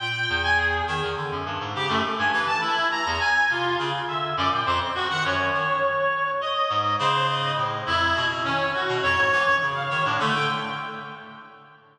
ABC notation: X:1
M:9/8
L:1/16
Q:3/8=69
K:none
V:1 name="Clarinet"
g3 ^g ^G2 z6 =G A, z ^g B a | E2 ^a2 ^g2 F2 z2 e2 d =g c z ^F ^f | ^c8 ^d4 =c2 d2 z2 | E3 z ^C2 ^F2 ^c4 z =f c D A, g |]
V:2 name="Clarinet" clef=bass
^A,,2 E,,4 ^D, E,, =D, ^F,, G,, ^G,, ^C, F,, z =G,, E, z | z3 E,, z2 C,2 ^C, z D,2 ^F,, ^A,, =F,, z2 ^D, | ^F,,2 ^D,2 z6 ^G,,2 ^C,4 A,,2 | F,,2 B,,2 ^D,2 z B,, F,, ^G,, E, ^F,, ^C,2 D, A,, =D,2 |]